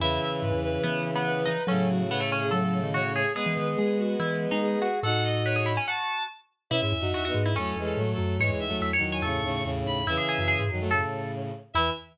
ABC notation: X:1
M:4/4
L:1/16
Q:1/4=143
K:E
V:1 name="Violin"
e2 e z B2 B2 z4 B4 | A2 F2 c3 G A A3 c4 | B2 B z G2 F2 z4 G4 | f2 d2 c3 z a4 z4 |
e e3 e2 z2 (3A4 A4 A4 | c2 e2 z3 g c'4 z2 b2 | e6 z10 | e4 z12 |]
V:2 name="Pizzicato Strings"
E8 B,3 B,3 D2 | C2 z2 B, A, C2 A4 F2 G2 | G8 E3 D3 F2 | A4 B G E C F4 z4 |
E z3 F F2 E C8 | c z3 e c2 c A8 | E G G2 G4 A4 z4 | E4 z12 |]
V:3 name="Violin"
[C,E,]16 | [A,,C,]16 | [G,B,]16 | [DF]8 z8 |
(3[CE]4 [DF]4 [B,D]4 [F,A,]2 [E,G,]2 [F,A,]4 | (3[E,G,]4 [F,A,]4 [D,F,]4 [A,,C,]2 [A,,C,]2 [A,,C,]4 | [C,E,]6 [D,F,] [F,A,] [A,,C,]6 z2 | E,4 z12 |]
V:4 name="Vibraphone" clef=bass
E,,2 z2 G,, E,,3 E,6 E, z | F,4 C,4 F,3 D,2 z3 | z E, D,2 G,4 E,3 G,3 z2 | A,,8 z8 |
B,, G,, E,, F,, E,,2 G,,2 E,,2 E,,2 A,,2 F,,2 | G,, E,, D,, D,, E,,2 E,,2 E,,2 D,,2 E,,2 D,,2 | E,, z2 F,,2 G,, F,,4 z6 | E,,4 z12 |]